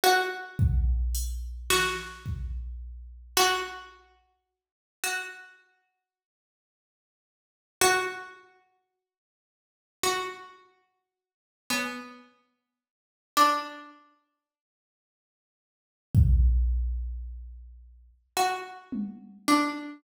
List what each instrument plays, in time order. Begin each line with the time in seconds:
0.04 pizzicato strings F#4
0.59 kick
1.15 closed hi-hat
1.70 pizzicato strings F#4, snare
2.26 kick
3.37 pizzicato strings F#4, clap
5.03 pizzicato strings F#4
7.81 pizzicato strings F#4, closed hi-hat
10.03 pizzicato strings F#4
11.70 pizzicato strings B3, cowbell
13.37 pizzicato strings D4
16.15 kick
18.37 pizzicato strings F#4
18.92 high tom
19.48 pizzicato strings D4